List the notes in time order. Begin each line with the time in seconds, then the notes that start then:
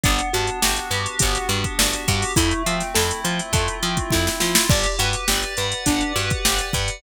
0.04 G1 B3 D4, kick, closed hi-hat
0.19 closed hi-hat
0.33 G2 D4 F#4, closed hi-hat
0.47 closed hi-hat
0.62 G1 F#4 G4, snare
0.76 closed hi-hat
0.91 G2 G4 B4, closed hi-hat
1.06 closed hi-hat
1.19 G1 B3 G4, kick, closed hi-hat
1.35 snare, closed hi-hat
1.49 G2 D4 F#4, closed hi-hat
1.64 kick, closed hi-hat
1.79 G1 D4 F#4, snare
1.93 closed hi-hat
2.06 G2 F#4 G4, kick, closed hi-hat
2.22 open hi-hat
2.36 F2 A3 E4, kick, closed hi-hat
2.51 closed hi-hat
2.66 F3 C4 F4, closed hi-hat
2.80 snare, closed hi-hat
2.95 F2 E4 A4, snare
3.11 closed hi-hat
3.24 F3 F4 C5, closed hi-hat
3.39 closed hi-hat
3.53 F2 A3 A4, kick, closed hi-hat
3.68 closed hi-hat
3.83 F3 C4 F4, closed hi-hat
3.97 kick, closed hi-hat
4.11 F2 E4, kick, snare
4.27 snare
4.40 F3 F4, snare
4.55 snare
4.70 G1 D4 G4, kick, crash
4.83 closed hi-hat
4.99 G2 F#4 B4, closed hi-hat
5.13 closed hi-hat
5.28 G1 G4 D5, snare
5.43 closed hi-hat
5.57 G2 B4 F#5, closed hi-hat
5.72 closed hi-hat
5.86 G1 D4 G4, kick, closed hi-hat
6.01 closed hi-hat
6.15 G2 F#4 B4, closed hi-hat
6.30 kick, closed hi-hat
6.45 G1 G4 D5, snare
6.59 closed hi-hat
6.73 G2 B4 F#5, kick, closed hi-hat
6.88 closed hi-hat